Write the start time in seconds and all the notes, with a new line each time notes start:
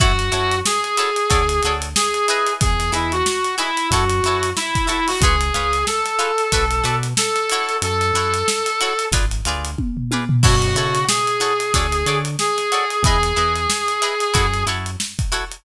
0.00 F#2 E4 F#4 A4 C#5, kick, closed hi-hat
0.19 closed hi-hat
0.32 F#2 E4 F#4 A4 C#5, closed hi-hat
0.51 closed hi-hat
0.65 G#4, snare
0.84 closed hi-hat
0.97 E4 F#4 A4 C#5, closed hi-hat
1.16 closed hi-hat
1.30 D2 F#4 A4 C#5 D5, kick, closed hi-hat
1.49 closed hi-hat
1.63 D2 F#4 A4 C#5, closed hi-hat
1.67 D5
1.82 closed hi-hat
1.96 G#4, snare
2.14 closed hi-hat
2.28 E4 G#4 B4 D#5, closed hi-hat
2.47 closed hi-hat
2.61 E2 G#4, kick, closed hi-hat
2.80 snare, closed hi-hat
2.92 E2 E4 G#4 B4 D#5, closed hi-hat
3.12 F#4, closed hi-hat
3.26 snare
3.45 closed hi-hat
3.58 E4 G#4 B4 D#5, closed hi-hat
3.77 closed hi-hat
3.91 F#2 E4 F#4 A4 C#5, kick, closed hi-hat
4.10 closed hi-hat
4.23 F#2 E4 F#4 A4, snare, closed hi-hat
4.28 C#5
4.43 closed hi-hat
4.56 E4, snare
4.75 kick, closed hi-hat
4.87 E4 F#4 A4 C#5, closed hi-hat
5.07 F#4, snare, open hi-hat
5.21 C#2 F4 G#4 B4, kick, closed hi-hat
5.25 C#5
5.41 closed hi-hat
5.54 C#2 F4 G#4 B4 C#5, closed hi-hat
5.73 snare, closed hi-hat
5.87 A4, snare
6.05 snare, closed hi-hat
6.19 F4 G#4 B4 C#5, closed hi-hat
6.38 closed hi-hat
6.52 B1 F#4 A4 B4 D5, kick, closed hi-hat
6.71 closed hi-hat
6.84 B2 F#4 A4 B4 D5, closed hi-hat
7.03 snare, closed hi-hat
7.17 A4, snare
7.36 snare, closed hi-hat
7.50 E4 F#4 A4 C#5, closed hi-hat
7.69 closed hi-hat
7.82 F#2 A4, closed hi-hat
8.01 closed hi-hat
8.13 F#2 E4 F#4 A4 C#5, closed hi-hat
8.34 closed hi-hat
8.48 snare
8.66 closed hi-hat
8.81 E4 F#4 A4 C#5, closed hi-hat
8.99 closed hi-hat
9.12 G#1 F4 G#4 B4 D5, kick, closed hi-hat
9.31 closed hi-hat
9.45 D2 F4 G#4 B4 D5, closed hi-hat
9.65 closed hi-hat
9.78 kick, high tom
9.97 floor tom
10.11 F4 G#4 B4 D5, high tom
10.29 floor tom
10.43 F#2 E4 F#4 A4 C#5, kick, crash
10.62 closed hi-hat
10.75 C#3 E4 F#4 A4 C#5, snare, closed hi-hat
10.95 snare, closed hi-hat
11.08 G#4, snare
11.27 closed hi-hat
11.40 E4 F#4 A4 C#5, closed hi-hat
11.60 closed hi-hat
11.74 D2 F#4 A4 C#5 D5, kick, closed hi-hat
11.92 closed hi-hat
12.06 D3 F#4 A4 C#5 D5, closed hi-hat
12.25 closed hi-hat
12.39 G#4, snare
12.57 snare, closed hi-hat
12.72 F#4 A4 C#5 D5, closed hi-hat
12.90 closed hi-hat
13.03 E2 E4 G#4 B4, kick, closed hi-hat
13.07 D#5
13.23 closed hi-hat
13.36 E2 E4 G#4 B4 D#5, snare, closed hi-hat
13.56 closed hi-hat
13.70 snare
13.88 closed hi-hat
14.02 E4 G#4 B4 D#5, closed hi-hat
14.20 closed hi-hat
14.34 F#2 E4 F#4 A4 C#5, kick, closed hi-hat
14.54 closed hi-hat
14.67 F#2 E4 F#4 A4 C#5, closed hi-hat
14.86 closed hi-hat
15.00 snare
15.19 kick, closed hi-hat
15.32 E4 F#4 A4 C#5, closed hi-hat
15.51 closed hi-hat